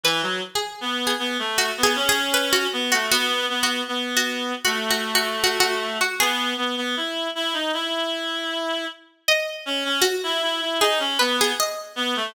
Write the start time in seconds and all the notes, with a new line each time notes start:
0.04 E3 B4
0.22 F#3
0.55 G#4
0.81 B3
1.07 G#4
1.19 B3
1.39 A3
1.58 F#4
1.78 B3
1.83 G#4
1.96 C#4
2.09 G#4
2.34 B4
2.53 F#4
2.73 B3
2.92 A3 F#4
3.11 B3 F#4
3.49 B3
3.63 F#4
3.88 B3
4.17 F#4
4.65 A3 F#4
4.91 F#4
5.15 F#4
5.44 F#4
5.60 F#4
6.01 F#4
6.19 B3 G#4
6.57 B3
6.77 B3
6.97 E4
7.35 E4
7.54 D#4
7.74 E4
9.28 D#5
9.66 C#4
9.85 C#4
10.01 F#4
10.23 E4
10.42 E4
10.61 E4
10.80 D#4 G#4
11.00 C#4
11.19 B3 B4
11.41 G#4
11.60 D#5
11.96 B3
12.16 A3